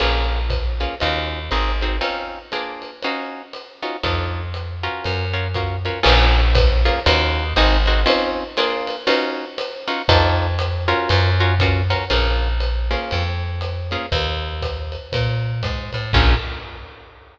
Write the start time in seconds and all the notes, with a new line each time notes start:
0.00 A#1 A#3 C#4 F4 G#4, crash, ride
0.50 kick, hi-hat pedal, ride
0.80 A#3 C#4 F4 G#4, ride
1.00 D#2 C#4 D#4 F4 F#4, ride
1.51 G#1 C4 D#4 F#4 G#4, hi-hat pedal, ride
1.81 C4 D#4 F#4 G#4, ride
2.01 C4 C#4 D#4 F4, ride
2.52 A#3 D4 F4 G#4, hi-hat pedal, ride
2.82 ride
3.03 C#4 D#4 F4 F#4, ride
3.53 hi-hat pedal, ride
3.82 C#4 D#4 F4 F#4, ride
4.03 F2 D4 D#4 F4 A4, kick, ride
4.54 hi-hat pedal, ride
4.83 C#4 F4 F#4 A#4, ride
5.04 F#2, ride
5.34 C#4 F4 F#4 A#4
5.54 C#4 F4 F#4 A#4, kick, hi-hat pedal, ride
5.85 C#4 F4 F#4 A#4, ride
6.03 A#1 A#3 C#4 F4 G#4, crash, ride
6.55 kick, hi-hat pedal, ride
6.85 A#3 C#4 F4 G#4, ride
7.06 D#2 C#4 D#4 F4 F#4, ride
7.56 G#1 C4 D#4 F#4 G#4, hi-hat pedal, ride
7.86 C4 D#4 F#4 G#4, ride
8.06 C4 C#4 D#4 F4, ride
8.57 A#3 D4 F4 G#4, hi-hat pedal, ride
8.87 ride
9.07 C#4 D#4 F4 F#4, ride
9.58 hi-hat pedal, ride
9.88 C#4 D#4 F4 F#4, ride
10.08 F2 D4 D#4 F4 A4, kick, ride
10.59 hi-hat pedal, ride
10.88 C#4 F4 F#4 A#4, ride
11.09 F#2, ride
11.40 C#4 F4 F#4 A#4
11.59 C#4 F4 F#4 A#4, kick, hi-hat pedal, ride
11.90 C#4 F4 F#4 A#4, ride
12.10 A#1 A#3 C#4 F4 G#4, ride
12.60 hi-hat pedal, ride
12.91 A#3 C#4 F4 G#4, ride
13.11 F2, ride
13.61 hi-hat pedal, ride
13.91 A#3 C#4 F4 G#4, ride
14.12 D#2, kick, ride
14.62 kick, hi-hat pedal, ride
14.92 ride
15.12 A#2, kick, ride
15.63 G#2, kick, hi-hat pedal, ride
15.93 A2, ride
16.13 A#1 A#3 C#4 F4 G#4, kick, crash